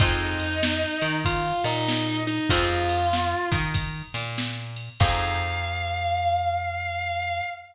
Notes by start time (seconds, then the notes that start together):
0.00 F2 C4 D#4 F4 G#4 D#5, kick, ride
0.40 ride
0.63 snare
1.01 D#3 D#4, ride
1.25 F4 F5, kick, ride
1.64 A#2 A#3 D#4 D#5, ride
1.88 snare
2.27 D#4 D#5, ride
2.49 F2 C4 D#4 F4 G#4 F5, kick, ride
2.89 ride
3.13 snare
3.51 D#3 D#4, kick, ride
3.74 kick, ride
4.14 A#2 A#3, ride
4.38 snare
4.76 ride
5.00 F2 C4 D#4 F4 G#4 F5, kick, crash